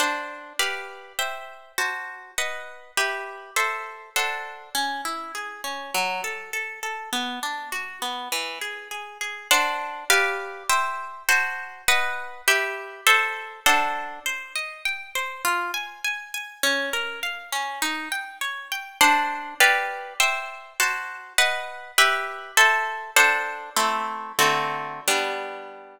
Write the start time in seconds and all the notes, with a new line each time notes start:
0.00 D4 C5 F#5 A5
0.59 G4 B4 D5 F5
1.19 C5 E5 G5
1.78 F#4 C5 A5
2.38 B4 D#5 F#5
2.97 G4 B4 E5
3.56 A4 C5 E5
4.16 D4 A4 C5 F#5
4.75 C#4
5.05 E4
5.35 G#4
5.64 C#4
5.94 F#3
6.24 A4
6.53 A4
6.83 A4
7.13 B3
7.43 D4
7.72 F#4
8.02 B3
8.32 E3
8.61 G#4
8.91 G#4
9.21 G#4
9.51 D4 C5 F#5 A5
10.10 G4 B4 D5 F5
10.69 C5 E5 G5
11.29 F#4 C5 A5
11.88 B4 D#5 F#5
12.48 G4 B4 E5
13.07 A4 C5 E5
13.66 D4 A4 C5 F#5
14.26 C5
14.56 D#5
14.85 G5
15.15 C5
15.45 F4
15.74 G#5
16.04 G#5
16.34 G#5
16.63 C#4
16.93 A#4
17.23 F5
17.52 C#4
17.82 D#4
18.12 G5
18.41 C#5
18.72 G5
19.01 D4 C5 F#5 A5
19.60 G4 B4 D5 F5
20.20 C5 E5 G5
20.80 F#4 C5 A5
21.38 B4 D#5 F#5
21.98 G4 B4 E5
22.57 A4 C5 E5
23.16 D4 A4 C5 F#5
23.76 A3 C4 E4
24.39 D3 A3 C4 F#4
25.08 G3 B3 D4